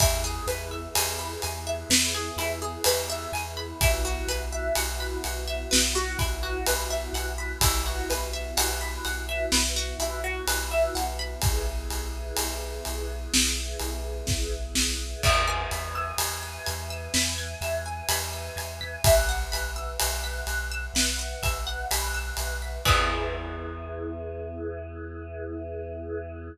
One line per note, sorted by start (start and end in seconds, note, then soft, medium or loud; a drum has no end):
0.00 0.39 E2 loud
0.00 3.78 B3 medium
0.00 0.21 E4 loud
0.00 3.78 E4 medium
0.00 3.78 G#4 medium
0.00 kick loud
0.00 ride loud
0.24 0.45 G#4 medium
0.47 0.87 E2 medium
0.47 0.69 B4 medium
0.47 ride medium
0.71 0.93 E5 medium
0.95 1.36 E2 medium
0.95 1.17 G#5 medium
0.95 ride loud
1.19 1.40 B5 medium
1.42 1.84 E2 loud
1.42 1.64 G#5 medium
1.42 ride medium
1.67 1.88 E5 medium
1.89 2.30 E2 loud
1.89 2.12 B4 medium
1.89 snare loud
2.14 2.36 G#4 medium
2.37 2.77 E2 loud
2.37 2.59 E4 medium
2.37 ride medium
2.62 2.83 G#4 medium
2.84 3.26 E2 medium
2.84 3.07 B4 medium
2.84 ride loud
3.10 3.31 E5 medium
3.32 3.73 E2 loud
3.32 3.55 G#5 medium
3.32 ride medium
3.57 3.78 B5 medium
3.81 4.21 B1 loud
3.81 7.59 B3 medium
3.81 4.02 E4 loud
3.81 7.59 E4 medium
3.81 7.59 F#4 medium
3.81 kick loud
3.81 ride loud
4.05 4.26 F#4 medium
4.27 4.68 B1 loud
4.27 4.50 B4 medium
4.27 ride medium
4.52 4.74 E5 medium
4.75 5.16 B1 loud
4.75 4.97 F#5 medium
4.75 ride loud
5.00 5.22 B5 medium
5.24 5.65 B1 loud
5.24 5.45 F#5 medium
5.24 ride medium
5.48 5.69 E5 medium
5.71 6.13 B1 loud
5.71 5.92 B4 medium
5.71 snare loud
5.95 6.17 F#4 medium
6.19 6.61 B1 medium
6.19 6.40 E4 medium
6.19 kick medium
6.19 ride medium
6.43 6.64 F#4 medium
6.66 7.08 B1 medium
6.66 6.88 B4 medium
6.66 ride loud
6.90 7.12 E5 medium
7.13 7.53 B1 loud
7.13 7.36 F#5 medium
7.13 ride medium
7.38 7.60 B5 medium
7.61 8.01 B1 loud
7.61 11.40 B3 medium
7.61 7.84 E4 loud
7.61 11.40 E4 medium
7.61 11.40 F#4 medium
7.61 kick loud
7.61 ride loud
7.86 8.07 F#4 medium
8.10 8.51 B1 medium
8.10 8.31 B4 medium
8.10 ride medium
8.33 8.55 E5 medium
8.57 8.98 B1 loud
8.57 8.79 F#5 medium
8.57 ride loud
8.81 9.02 B5 medium
9.05 9.46 B1 medium
9.05 9.26 F#5 medium
9.05 ride medium
9.29 9.50 E5 medium
9.52 9.93 B1 loud
9.52 9.74 B4 medium
9.52 snare loud
9.76 9.98 F#4 medium
9.99 10.39 B1 medium
9.99 10.21 E4 medium
9.99 ride medium
10.24 10.45 F#4 medium
10.47 10.88 B1 loud
10.47 10.69 B4 medium
10.47 ride loud
10.71 10.93 E5 medium
10.95 11.35 B1 medium
10.95 11.17 F#5 medium
10.95 ride medium
11.19 11.40 B5 medium
11.41 11.85 B1 loud
11.41 15.21 B3 medium
11.41 15.21 E4 medium
11.41 15.21 G#4 medium
11.41 kick loud
11.41 ride loud
11.90 12.31 B1 loud
11.90 ride medium
12.37 12.78 B1 medium
12.37 ride loud
12.85 13.27 B1 loud
12.85 ride medium
13.34 13.74 B1 loud
13.34 snare loud
13.80 14.21 B1 loud
13.80 ride medium
14.27 14.69 B1 loud
14.27 kick loud
14.27 snare medium
14.75 15.15 B1 loud
14.75 snare loud
15.23 15.66 E2 loud
15.23 19.01 B4 medium
15.23 15.45 E5 loud
15.23 19.01 E5 medium
15.23 19.01 G#5 medium
15.23 kick loud
15.23 crash loud
15.48 15.69 G#5 medium
15.71 16.12 E2 loud
15.71 15.93 B5 medium
15.71 ride medium
15.95 16.17 E6 medium
16.18 16.58 E2 medium
16.18 16.40 G#6 medium
16.18 ride loud
16.43 16.64 B6 medium
16.66 17.08 E2 loud
16.66 16.88 G#6 medium
16.66 ride medium
16.90 17.12 E6 medium
17.14 17.55 E2 loud
17.14 17.36 B5 medium
17.14 snare loud
17.38 17.59 G#5 medium
17.61 18.01 E2 loud
17.61 17.83 E5 medium
17.61 ride medium
17.86 18.07 G#5 medium
18.09 18.49 E2 loud
18.09 18.31 B5 medium
18.09 ride loud
18.33 18.55 E6 medium
18.56 18.97 E2 medium
18.56 18.79 G#6 medium
18.56 ride medium
18.81 19.02 B6 medium
19.04 19.44 B1 loud
19.04 22.82 B4 medium
19.04 22.82 E5 medium
19.04 19.26 E5 medium
19.04 22.82 F#5 medium
19.04 kick loud
19.04 ride loud
19.29 19.50 F#5 medium
19.52 19.93 B1 medium
19.52 19.73 B5 medium
19.52 ride medium
19.76 19.97 E6 medium
20.00 20.42 B1 loud
20.00 20.21 F#6 medium
20.00 ride loud
20.24 20.45 B6 medium
20.47 20.87 B1 loud
20.47 20.69 F#6 medium
20.47 ride medium
20.72 20.93 E6 medium
20.94 21.34 B1 medium
20.94 21.16 B5 medium
20.94 snare loud
21.19 21.40 F#5 medium
21.42 21.83 B1 medium
21.42 21.64 E5 medium
21.42 kick medium
21.42 ride medium
21.67 21.88 F#5 medium
21.91 22.31 B1 loud
21.91 22.12 B5 medium
21.91 ride loud
22.14 22.36 E6 medium
22.37 22.78 B1 loud
22.37 22.59 F#6 medium
22.37 ride medium
22.62 22.84 B6 medium
22.85 26.50 E2 loud
22.85 26.48 B3 loud
22.85 26.48 E4 loud
22.85 26.48 G#4 loud
22.85 26.48 B4 loud
22.85 kick loud
22.85 crash loud